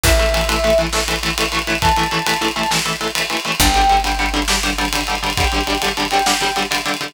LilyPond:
<<
  \new Staff \with { instrumentName = "Brass Section" } { \time 12/8 \key a \minor \tempo 4. = 135 e''4. e''4 r2. r8 | a''2~ a''8 a''8 r2. | g''4. g''4 r2. r8 | g''8 g''4 r4 g''2 r4. | }
  \new Staff \with { instrumentName = "Overdriven Guitar" } { \time 12/8 \key a \minor <e a>8 <e a>8 <e a>8 <e a>8 <e a>8 <e a>8 <e a>8 <e a>8 <e a>8 <e a>8 <e a>8 <e a>8 | <e a>8 <e a>8 <e a>8 <e a>8 <e a>8 <e a>8 <e a>8 <e a>8 <e a>8 <e a>8 <e a>8 <e a>8 | <d g>8 <d g>8 <d g>8 <d g>8 <d g>8 <d g>8 <d g>8 <d g>8 <d g>8 <d g>8 <d g>8 <d g>8 | <d g>8 <d g>8 <d g>8 <d g>8 <d g>8 <d g>8 <d g>8 <d g>8 <d g>8 <d g>8 <d g>8 <d g>8 | }
  \new Staff \with { instrumentName = "Electric Bass (finger)" } { \clef bass \time 12/8 \key a \minor a,,1.~ | a,,1. | g,,1.~ | g,,1. | }
  \new DrumStaff \with { instrumentName = "Drums" } \drummode { \time 12/8 <cymc bd>16 cymr16 cymr16 cymr16 cymr16 cymr16 cymr16 cymr16 cymr16 cymr16 cymr16 cymr16 sn16 cymr16 cymr16 cymr16 cymr16 cymr16 cymr16 cymr16 cymr16 cymr16 cymr16 cymr16 | <bd cymr>16 cymr16 cymr16 cymr16 cymr16 cymr16 cymr16 cymr16 cymr16 cymr16 cymr16 cymr16 sn16 cymr16 cymr16 cymr16 cymr16 cymr16 cymr16 cymr16 cymr16 cymr16 cymr16 cymr16 | <bd cymr>16 cymr16 cymr16 cymr16 cymr16 cymr16 cymr16 cymr16 cymr16 cymr16 cymr16 cymr16 sn16 cymr16 cymr16 cymr16 cymr16 cymr16 cymr16 cymr16 cymr16 cymr16 cymr16 cymr16 | <bd cymr>16 cymr16 cymr16 cymr16 cymr16 cymr16 cymr16 cymr16 cymr16 cymr16 cymr16 cymr16 sn16 cymr16 cymr16 cymr16 cymr16 cymr16 cymr16 cymr16 cymr16 cymr16 cymr16 cymr16 | }
>>